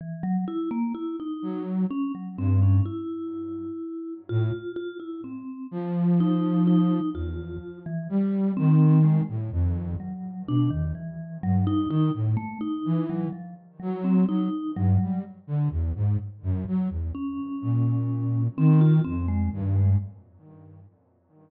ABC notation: X:1
M:6/8
L:1/16
Q:3/8=42
K:none
V:1 name="Flute" clef=bass
z6 ^F,2 z2 G,,2 | z6 A,, z5 | F,6 E,,2 z2 G,2 | ^D,3 A,, F,,2 z2 B,, E,, z2 |
G,,2 ^D, A,, z2 E,2 z2 ^F,2 | ^F, z G,, G, z D, E,, ^G,, z ^F,, F, E,, | z2 ^A,,4 ^D,2 F,,2 G,,2 |]
V:2 name="Vibraphone"
E, ^F, E ^A, E ^D2 z ^C F, =C ^C | E6 F2 F E C2 | z2 ^D2 D2 F3 E, z2 | C2 ^G, z3 ^F,2 D ^D, E,2 |
^F, ^D D z A, D2 F, =F, z ^F, C | ^D2 ^F,2 z8 | ^C6 =C F C ^G, z G, |]